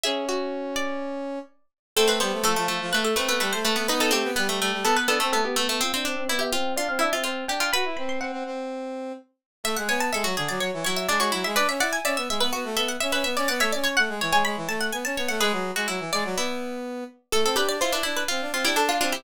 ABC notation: X:1
M:4/4
L:1/16
Q:1/4=125
K:A
V:1 name="Harpsichord"
G2 F10 z4 | [K:Am] A B c2 A4 B A B B B c B2 | B A G2 B4 A B A A A G A2 | c e2 e d e g2 d f e e c2 g g |
b2 b c' ^f8 z4 | [K:A] e f g a e2 z d c2 c e d c2 e | d e f g d2 z B F2 A f e B2 d | f e d c f2 z g b2 a f g a2 f |
B6 d10 | [K:Am] A2 B d c B2 B z3 G A F F G |]
V:2 name="Pizzicato Strings"
e6 d8 z2 | [K:Am] C C B,2 A, A, A,2 A,2 A, A, A,2 A, B, | ^D D C2 B, A, A,2 B,2 B, A, B,2 A, A, | C C D2 E G F2 F2 E F F2 G F |
B10 z6 | [K:A] e z c z A F G2 z2 E2 D F E2 | B z d z e e e2 z2 e2 e e e2 | d c z c z2 c c5 z2 c2 |
G3 F E4 E4 z4 | [K:Am] A A G2 F D E2 F2 F E D2 D E |]
V:3 name="Brass Section"
C12 z4 | [K:Am] A,2 G, A, F, F, F, F, A,2 C B, G, A, A, A, | B,2 A, B, G, G, G, G, B,2 D C A, B, B, B, | F D C C B, B, C2 D C D C C2 D2 |
^F E C2 C C C6 z4 | [K:A] A, G, B,2 G, F, D, F, F, E, F,2 G, G, F, G, | D C E2 C B, G, B, B, A, B,2 C C B, C | B, A, C2 A, G, E, G, G, E, A,2 B, C B, A, |
G, F,2 G, F, E, G, F, B,6 z2 | [K:Am] A, C D D E E D2 C D C D D2 C2 |]